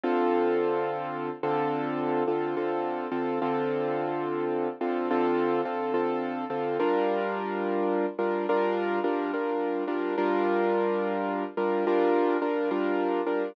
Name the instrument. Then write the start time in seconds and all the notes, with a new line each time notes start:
acoustic grand piano
0.04 D3 C4 F4 A4
1.43 D3 C4 F4 A4
2.27 D3 C4 F4 A4
2.57 D3 C4 F4 A4
3.12 D3 C4 F4 A4
3.42 D3 C4 F4 A4
4.81 D3 C4 F4 A4
5.11 D3 C4 F4 A4
5.65 D3 C4 F4 A4
5.94 D3 C4 F4 A4
6.50 D3 C4 F4 A4
6.80 G3 D4 F4 A#4
8.19 G3 D4 F4 A#4
8.49 G3 D4 F4 A#4
9.04 G3 D4 F4 A#4
9.34 G3 D4 F4 A#4
9.87 G3 D4 F4 A#4
10.18 G3 D4 F4 A#4
11.57 G3 D4 F4 A#4
11.87 G3 D4 F4 A#4
12.42 G3 D4 F4 A#4
12.71 G3 D4 F4 A#4
13.27 G3 D4 F4 A#4